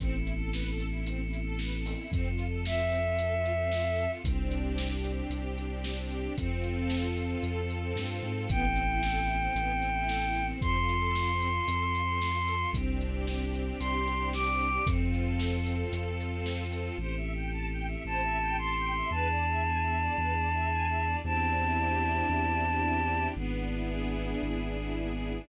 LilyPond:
<<
  \new Staff \with { instrumentName = "Violin" } { \time 12/8 \key a \minor \tempo 4. = 113 r1. | r4. e''1~ e''8 | r1. | r1. |
g''1. | c'''1. | r2. c'''4. d'''4. | r1. |
r2. a''4. c'''4. | a''1. | a''1. | r1. | }
  \new Staff \with { instrumentName = "String Ensemble 1" } { \time 12/8 \key a \minor c'8 e'8 a'8 b'8 a'8 e'8 c'8 e'8 a'8 b'8 a'8 e'8 | c'8 f'8 a'8 f'8 c'8 f'8 a'8 f'8 c'8 f'8 a'8 f'8 | c'8 d'8 g'8 d'8 c'8 d'8 g'8 d'8 c'8 d'8 g'8 d'8 | c'8 f'8 a'8 f'8 c'8 f'8 a'8 f'8 c'8 f'8 a'8 f'8 |
b8 c'8 e'8 a'8 e'8 c'8 b8 c'8 e'8 a'8 e'8 c'8 | c'8 f'8 a'8 f'8 c'8 f'8 a'8 f'8 c'8 f'8 a'8 f'8 | c'8 d'8 g'8 d'8 c'8 d'8 g'8 d'8 c'8 d'8 g'8 d'8 | c'8 f'8 a'8 f'8 c'8 f'8 a'8 f'8 c'8 f'8 a'8 f'8 |
c''8 e''8 g''8 a''8 g''8 e''8 c''8 e''8 g''8 a''8 g''8 e''8 | b'8 d''8 e''8 gis''8 e''8 d''8 b'8 d''8 e''8 gis''8 e''8 d''8 | c'8 d'8 e'8 g'8 e'8 d'8 c'8 d'8 e'8 g'8 e'8 d'8 | b8 d'8 e'8 gis'8 e'8 d'8 b8 d'8 e'8 gis'8 e'8 d'8 | }
  \new Staff \with { instrumentName = "Synth Bass 2" } { \clef bass \time 12/8 \key a \minor a,,1. | f,1. | c,2. c,2. | f,2. f,4. g,8. gis,8. |
a,,2. a,,2. | f,2. f,2. | c,2. c,2. | f,2. f,2. |
a,,2. a,,2. | e,2. e,2. | e,2. e,2. | gis,,2. gis,,2. | }
  \new Staff \with { instrumentName = "Choir Aahs" } { \time 12/8 \key a \minor <b c' e' a'>1. | <c' f' a'>1. | <c' d' g'>1. | <c' f' a'>1. |
<b c' e' a'>1. | <c' f' a'>1. | <c' d' g'>1. | <c' f' a'>1. |
<c' e' g' a'>1. | <b d' e' gis'>1. | <c' d' e' g'>1. | <b d' e' gis'>1. | }
  \new DrumStaff \with { instrumentName = "Drums" } \drummode { \time 12/8 <hh bd>8. hh8. sn8. hh8. hh8. hh8. sn8. hho8. | <hh bd>8. hh8. sn8. hh8. hh8. hh8. sn8. hh8. | <hh bd>8. hh8. sn8. hh8. hh8. hh8. sn8. hh8. | <hh bd>8. hh8. sn8. hh8. hh8. hh8. sn8. hh8. |
<hh bd>8. hh8. sn8. hh8. hh8. hh8. sn8. hh8. | <hh bd>8. hh8. sn8. hh8. hh8. hh8. sn8. hh8. | <hh bd>8. hh8. sn8. hh8. hh8. hh8. sn8. hh8. | <hh bd>8. hh8. sn8. hh8. hh8. hh8. sn8. hh8. |
r4. r4. r4. r4. | r4. r4. r4. r4. | r4. r4. r4. r4. | r4. r4. r4. r4. | }
>>